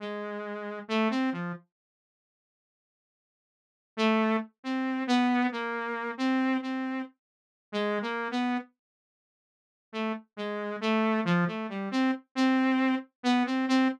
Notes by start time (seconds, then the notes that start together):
0.00 G#3
0.88 A3
1.10 C4
1.32 F3
3.97 A3
4.64 C4
5.07 B3
5.52 A#3
6.18 C4
6.62 C4
7.72 G#3
8.02 A#3
8.31 B3
9.93 A3
10.37 G#3
10.81 A3
11.25 F3
11.47 A3
11.69 G3
11.91 C4
12.35 C4
13.23 B3
13.46 C4
13.68 C4